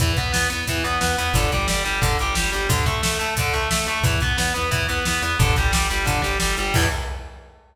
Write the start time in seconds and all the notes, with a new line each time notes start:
0.00 E2 E3, kick, closed hi-hat
0.17 E2 B3, kick, closed hi-hat
0.32 E2 B3, snare
0.50 E2 B3, closed hi-hat
0.67 E2 E3, kick, closed hi-hat
0.84 E2 B3, closed hi-hat
1.01 E2 B3, snare
1.18 E2 B3, closed hi-hat
1.33 G1 D3, kick, closed hi-hat
1.52 G1 G3, kick, closed hi-hat
1.67 G1 G3, snare
1.85 G1 G3, closed hi-hat
2.01 G1 D3, kick, closed hi-hat
2.19 G1 G3, closed hi-hat
2.35 G1 G3, snare
2.52 G1 G3, closed hi-hat
2.69 D2 D3, kick, closed hi-hat
2.86 D2 A3, kick, closed hi-hat
3.03 D2 A3, snare
3.19 D2 A3, closed hi-hat
3.36 D2 D3, kick, closed hi-hat
3.54 D2 A3, closed hi-hat
3.71 D2 A3, snare
3.86 D2 A3, closed hi-hat
4.03 E2 E3, kick, closed hi-hat
4.20 E2 B3, kick, closed hi-hat
4.38 E2 B3, snare
4.54 E2 B3, closed hi-hat
4.71 E2 E3, kick, closed hi-hat
4.88 E2 B3, closed hi-hat
5.05 E2 B3, snare
5.22 E2 B3, closed hi-hat
5.39 G1 D3, kick, closed hi-hat
5.56 G1 G3, kick, closed hi-hat
5.72 G1 G3, snare
5.90 G1 G3, closed hi-hat
6.05 G1 D3, kick, closed hi-hat
6.22 G1 G3, closed hi-hat
6.40 G1 G3, snare
6.57 G1 G3, closed hi-hat
6.74 E2 E3 B3, kick, crash